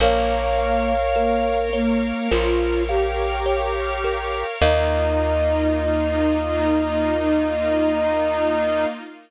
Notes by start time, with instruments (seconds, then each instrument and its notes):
0.00 electric bass (finger) A#1, flute A#3, pad 5 (bowed) A#4 C#5 F5, kalimba A#4, ocarina C#5 F5
0.59 kalimba F5
1.16 flute A#3, kalimba A#4
1.73 flute A#3, kalimba C#5
2.31 electric bass (finger) A#1, flute F4, kalimba A#4
2.89 flute G4, kalimba F5
3.46 kalimba C#5
4.04 kalimba A#4
4.61 electric bass (finger) D#2, pad 5 (bowed) A#3 D#4 F4, flute D#4, kalimba A#4 D#5 F5, ocarina D#5